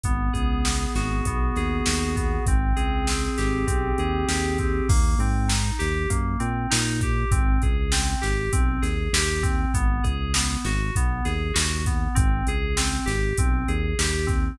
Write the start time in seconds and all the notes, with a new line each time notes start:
0.04 G#1 B3, kick, closed hi-hat
0.33 C#2 G#4, kick, closed hi-hat
0.65 B3, snare
0.95 G#1 F#4, snare, closed hi-hat
1.25 B1 B3, kick, closed hi-hat
1.56 D#2 G#4, snare, closed hi-hat
1.86 D#2 F#4, snare
2.16 B3, kick, closed hi-hat
2.46 G#1 C4, kick, closed hi-hat
2.76 C#2 G#4, closed hi-hat
3.07 C4, snare
3.38 G#1 G4, snare, closed hi-hat
3.67 B1 C4, kick, closed hi-hat
3.98 D#2 G#4, closed hi-hat
4.28 D#2 G4, snare
4.58 C4, kick, closed hi-hat
4.89 D#2 A#3, kick, crash
5.18 G#2 C4, closed hi-hat
5.48 D#4, snare
5.79 D#2 G4, snare, closed hi-hat
6.10 F#2 A#3, kick, closed hi-hat
6.40 A#2 C4, closed hi-hat
6.70 A#2 D#4, snare
7.01 G4, kick, closed hi-hat
7.31 G#1 C4, kick, closed hi-hat
7.62 C#2 G#4, kick, closed hi-hat
7.92 C4, snare
8.21 G#1 G4, snare, closed hi-hat
8.52 B1 C4, kick, closed hi-hat
8.82 D#2 G#4, snare, closed hi-hat
9.13 D#2 G4, snare
9.43 C4, kick, closed hi-hat
9.74 G#1 B3, kick, closed hi-hat
10.04 C#2 G#4, kick, closed hi-hat
10.34 B3, snare
10.65 G#1 F#4, snare, closed hi-hat
10.95 B1 B3, kick, closed hi-hat
11.25 D#2 G#4, snare, closed hi-hat
11.54 D#2 F#4, snare
11.86 B3, kick, closed hi-hat
12.15 G#1 C4, kick, closed hi-hat
12.47 C#2 G#4, closed hi-hat
12.77 C4, snare
13.06 G#1 G4, snare, closed hi-hat
13.38 B1 C4, kick, closed hi-hat
13.68 D#2 G#4, closed hi-hat
13.99 D#2 G4, snare
14.27 C4, kick, closed hi-hat